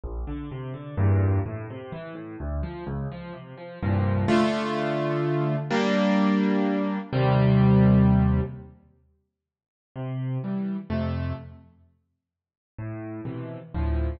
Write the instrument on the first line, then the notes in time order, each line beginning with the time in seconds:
acoustic grand piano
0.04 A#1
0.27 D3
0.51 C3
0.74 D3
0.98 E2 G2 A#2
1.46 A2
1.70 C3
1.92 E3
2.15 A2
2.40 D2
2.63 F3
2.87 C#2
3.12 F3
3.33 C3
3.58 F3
3.83 C2 G2 A#2 F3
4.28 D3 A3 F4
5.71 G3 A#3 D4
7.13 D#2 C3 G3
9.96 C3
10.44 E3 G3
10.90 F2 C3 A3
12.79 A2
13.25 B2 C3 E3
13.74 D2 A2 F3